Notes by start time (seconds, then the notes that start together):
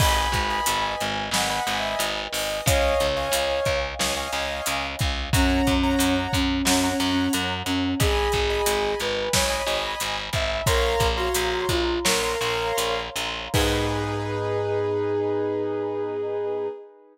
0.00 G#1 B4 D#5 G#5 B5, kick, crash
0.32 G#1, kick, closed hi-hat
0.50 D#5 G#5 B5
0.66 G#1, closed hi-hat
0.99 G#1 G#5, closed hi-hat
1.31 G#1 D#5 F#5 G#5 B5, snare
1.50 D#5 G#5 B5
1.55 F#5
1.67 G#1 D#5 G#5 B5, closed hi-hat
1.78 E5
1.99 G#1, closed hi-hat
2.33 G#1 D#5, open hi-hat
2.66 C#2 C#5 D#5 F5 G#5, kick, closed hi-hat
3.00 C#2, closed hi-hat
3.17 C#5 D#5 F5 G#5
3.32 C#2, closed hi-hat
3.65 C#2, kick, closed hi-hat
3.99 C#2 C#5 D#5 F5 G#5, snare
4.17 C#5 D#5 F5 G#5
4.33 C#2 C#5 D#5 F5 G#5, closed hi-hat
4.66 C#2, closed hi-hat
4.99 C#2, kick, closed hi-hat
5.33 F#2 C#4 C#5 F#5 A#5, kick, closed hi-hat
5.67 F#2, kick, closed hi-hat
5.83 C#5 F#5 A#5
5.99 F#2, closed hi-hat
6.33 F#2 C#4, kick, closed hi-hat
6.65 F#2 C#4 C#5 F#5 A#5, snare
6.83 C#5 F#5 A#5
6.89 C#4
7.00 F#2 C#5 F#5 A#5, closed hi-hat
7.11 C#4
7.33 F#2, closed hi-hat
7.66 F#2 C#4, closed hi-hat
8.00 G#1 G#4 D#5 G#5 B5, kick, closed hi-hat
8.32 G#1, kick, closed hi-hat
8.50 D#5 G#5 B5
8.66 G#1, closed hi-hat
9.00 G#1 B4, closed hi-hat
9.33 G#1 C#5 D#5 G#5 B5, kick, snare
9.50 D#5 G#5 B5
9.56 C#5
9.67 G#1 D#5 G#5 B5, closed hi-hat
9.77 D#5
10.00 G#1, closed hi-hat
10.33 G#1 E5, kick, closed hi-hat
10.66 A#1 A#4 C#5 F5 A#5 C6, kick, closed hi-hat
11.00 A#1, kick, closed hi-hat
11.17 F#4 C#5 F5 A#5 C6
11.35 A#1, closed hi-hat
11.69 A#1 F4, kick, closed hi-hat
12.05 A#1 A#4 C#5 F5 A#5 C6, snare
12.23 C#5 F5 A#5 C6
12.41 A#1 C#5 F5 A#5 C6, closed hi-hat
12.78 A#1, closed hi-hat
13.16 A#1, closed hi-hat
13.53 G#2 B3 D#4 G#4 B4, kick, crash